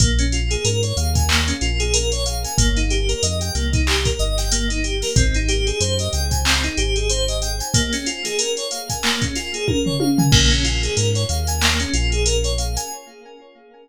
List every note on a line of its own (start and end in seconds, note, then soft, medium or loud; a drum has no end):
0.00 0.57 A#1 loud
0.00 0.17 A#3 loud
0.00 kick loud
0.00 closed hi-hat loud
0.19 0.31 C#4 medium
0.19 closed hi-hat medium
0.32 0.49 F4 medium
0.32 closed hi-hat medium
0.51 0.63 G#4 medium
0.51 closed hi-hat medium
0.65 0.93 G#2 medium
0.65 0.81 A#4 medium
0.65 closed hi-hat loud
0.83 0.95 C#5 medium
0.83 closed hi-hat medium
0.97 1.53 D#2 medium
0.97 1.14 F5 medium
0.97 closed hi-hat medium
1.15 1.28 G#5 medium
1.15 kick medium
1.15 closed hi-hat medium
1.29 1.46 A#3 medium
1.29 clap loud
1.48 1.60 C#4 medium
1.48 closed hi-hat medium
1.61 2.46 A#1 medium
1.61 1.78 F4 medium
1.61 closed hi-hat medium
1.80 1.92 G#4 medium
1.80 closed hi-hat medium
1.94 2.10 A#4 medium
1.94 closed hi-hat loud
2.12 2.25 C#5 medium
2.12 closed hi-hat medium
2.26 2.42 F5 medium
2.26 closed hi-hat medium
2.44 2.57 G#5 medium
2.44 closed hi-hat medium
2.58 3.14 G1 loud
2.58 2.74 A#3 loud
2.58 kick loud
2.58 closed hi-hat loud
2.76 2.89 D#4 medium
2.76 closed hi-hat medium
2.90 3.07 G4 medium
2.90 closed hi-hat medium
3.09 3.21 A#4 medium
3.09 closed hi-hat medium
3.23 3.51 F2 medium
3.23 3.39 D#5 medium
3.23 closed hi-hat loud
3.41 3.53 G5 medium
3.41 closed hi-hat medium
3.55 4.11 C2 medium
3.55 3.72 A#3 medium
3.55 closed hi-hat medium
3.73 3.86 D#4 medium
3.73 kick loud
3.73 closed hi-hat medium
3.87 4.04 G4 medium
3.87 clap loud
4.05 4.18 A#4 medium
4.05 kick medium
4.05 closed hi-hat medium
4.19 5.03 G1 medium
4.19 4.36 D#5 medium
4.19 closed hi-hat medium
4.38 4.51 G5 medium
4.38 snare soft
4.38 closed hi-hat medium
4.52 4.68 A#3 medium
4.52 closed hi-hat loud
4.70 4.83 D#4 medium
4.70 closed hi-hat medium
4.84 5.00 G4 medium
4.84 closed hi-hat medium
5.02 5.15 A#4 medium
5.02 snare soft
5.02 open hi-hat medium
5.16 5.72 G#1 loud
5.16 5.33 C4 medium
5.16 kick loud
5.16 closed hi-hat loud
5.34 5.47 D#4 medium
5.34 closed hi-hat medium
5.48 5.65 G4 medium
5.48 closed hi-hat medium
5.67 5.79 G#4 medium
5.67 closed hi-hat medium
5.80 6.09 F#2 medium
5.80 5.97 C5 medium
5.80 closed hi-hat loud
5.99 6.12 D#5 medium
5.99 closed hi-hat medium
6.13 6.69 C#2 medium
6.13 6.30 G5 medium
6.13 closed hi-hat medium
6.31 6.43 G#5 medium
6.31 kick medium
6.31 closed hi-hat medium
6.45 6.62 C4 medium
6.45 clap loud
6.64 6.76 D#4 medium
6.64 closed hi-hat medium
6.77 7.62 G#1 medium
6.77 6.94 G4 medium
6.77 closed hi-hat medium
6.96 7.08 G#4 medium
6.96 closed hi-hat medium
7.10 7.26 C5 loud
7.10 closed hi-hat loud
7.28 7.41 D#5 medium
7.28 closed hi-hat medium
7.42 7.58 G5 medium
7.42 closed hi-hat medium
7.60 7.73 G#5 medium
7.60 closed hi-hat medium
7.74 7.91 A#3 loud
7.74 kick loud
7.74 closed hi-hat loud
7.93 8.05 C#4 medium
7.93 snare soft
7.93 closed hi-hat medium
8.06 8.23 F4 medium
8.06 closed hi-hat medium
8.25 8.37 G#4 medium
8.25 snare soft
8.25 closed hi-hat medium
8.39 8.55 A#4 medium
8.39 closed hi-hat loud
8.57 8.70 C#5 medium
8.57 closed hi-hat medium
8.71 8.88 F5 medium
8.71 closed hi-hat medium
8.90 9.02 G#5 medium
8.90 kick medium
8.90 closed hi-hat medium
9.03 9.20 A#3 medium
9.03 clap loud
9.22 9.34 C#4 medium
9.22 kick medium
9.22 closed hi-hat medium
9.35 9.52 F4 medium
9.35 snare soft
9.35 closed hi-hat medium
9.54 9.66 G#4 medium
9.54 closed hi-hat medium
9.68 9.85 A#4 medium
9.68 kick medium
9.68 high tom medium
9.86 9.99 C#5 medium
9.86 floor tom medium
10.00 10.17 F5 medium
10.00 high tom medium
10.18 10.31 G#5 medium
10.18 floor tom loud
10.32 10.89 A#1 medium
10.32 10.49 A#3 loud
10.32 kick loud
10.32 crash loud
10.51 10.63 C#4 medium
10.51 closed hi-hat medium
10.64 10.81 F4 medium
10.64 closed hi-hat medium
10.83 10.95 G#4 medium
10.83 closed hi-hat medium
10.97 11.25 G#2 medium
10.97 11.14 A#4 medium
10.97 closed hi-hat loud
11.15 11.28 C#5 medium
11.15 closed hi-hat medium
11.29 11.85 D#2 medium
11.29 11.46 F5 medium
11.29 closed hi-hat medium
11.47 11.60 G#5 medium
11.47 closed hi-hat medium
11.61 11.78 A#3 medium
11.61 clap loud
11.80 11.92 C#4 medium
11.80 closed hi-hat medium
11.93 12.78 A#1 medium
11.93 12.10 F4 medium
11.93 closed hi-hat medium
12.12 12.24 G#4 medium
12.12 closed hi-hat medium
12.26 12.42 A#4 medium
12.26 closed hi-hat loud
12.44 12.57 C#5 medium
12.44 closed hi-hat medium
12.58 12.75 F5 medium
12.58 closed hi-hat medium
12.76 12.89 G#5 medium
12.76 closed hi-hat medium